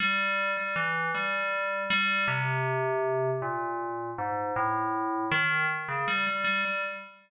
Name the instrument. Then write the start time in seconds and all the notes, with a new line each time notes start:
tubular bells
0.00 G3
0.57 G3
0.76 E3
1.15 G3
1.90 G3
2.28 C3
3.42 A#2
4.18 G#2
4.56 A2
5.31 D#3
5.88 C#3
6.08 G3
6.27 G3
6.44 G3
6.65 G3